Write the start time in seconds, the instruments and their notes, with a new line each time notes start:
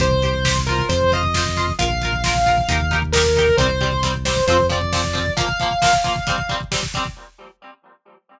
0.00 synth bass 1 C2, acoustic guitar (steel) G4 C5, distortion guitar C5, kick, closed hi-hat
0.11 kick
0.22 acoustic guitar (steel) G4 C5, kick, closed hi-hat
0.34 kick
0.45 acoustic guitar (steel) G4 C5, kick, snare
0.56 kick
0.67 acoustic guitar (steel) F4 C5, distortion guitar A#4, kick, closed hi-hat
0.78 kick
0.89 synth bass 1 F2, distortion guitar C5, kick, closed hi-hat
1.01 kick
1.12 acoustic guitar (steel) F4 C5, distortion guitar D#5, kick, closed hi-hat
1.23 kick
1.34 acoustic guitar (steel) F4 C5, kick, snare
1.45 kick
1.57 acoustic guitar (steel) F4 C5, kick, closed hi-hat
1.68 kick
1.79 synth bass 1 A#1, acoustic guitar (steel) F4 A#4, distortion guitar F5, kick, closed hi-hat
1.90 kick
2.01 acoustic guitar (steel) F4 A#4, kick, closed hi-hat
2.13 kick
2.24 acoustic guitar (steel) F4 A#4, kick, snare
2.35 kick
2.46 acoustic guitar (steel) F4 A#4, kick, closed hi-hat
2.57 kick
2.68 synth bass 1 D#2, acoustic guitar (steel) D#4 G4 A#4, kick, closed hi-hat
2.80 kick
2.91 acoustic guitar (steel) D#4 G4 A#4, kick, closed hi-hat
3.02 kick
3.12 acoustic guitar (steel) D#4 G4, distortion guitar A#4, kick, snare
3.17 acoustic guitar (steel) A#4
3.25 kick
3.36 acoustic guitar (steel) D#4 G4, kick, closed hi-hat
3.40 acoustic guitar (steel) A#4
3.47 kick
3.57 synth bass 1 C2, acoustic guitar (steel) G3 C4, distortion guitar C5, kick, closed hi-hat
3.69 kick
3.81 acoustic guitar (steel) G3 C4, kick, closed hi-hat
3.92 kick
4.03 acoustic guitar (steel) G3 C4, kick, closed hi-hat
4.14 kick
4.25 acoustic guitar (steel) G3 C4, distortion guitar C5, kick, snare
4.37 kick
4.47 synth bass 1 F2, acoustic guitar (steel) F3 C4, distortion guitar C5, kick, closed hi-hat
4.59 kick
4.69 acoustic guitar (steel) F3 C4, distortion guitar D5, kick, closed hi-hat
4.81 kick
4.92 acoustic guitar (steel) F3 C4, kick, snare
5.04 kick
5.13 acoustic guitar (steel) F3 C4, kick, closed hi-hat
5.26 kick
5.37 acoustic guitar (steel) F3 A#3, distortion guitar F5, kick, closed hi-hat
5.49 kick
5.60 acoustic guitar (steel) F3 A#3, kick, closed hi-hat
5.71 kick
5.82 acoustic guitar (steel) F3 A#3, kick, snare
5.93 kick
6.04 acoustic guitar (steel) F3 A#3, kick, closed hi-hat
6.16 kick
6.27 acoustic guitar (steel) G3 C4, kick, closed hi-hat
6.38 kick
6.49 acoustic guitar (steel) G3 C4, kick, closed hi-hat
6.61 kick
6.72 acoustic guitar (steel) G3 C4, kick, snare
6.83 kick
6.94 acoustic guitar (steel) G3 C4, kick, closed hi-hat
7.05 kick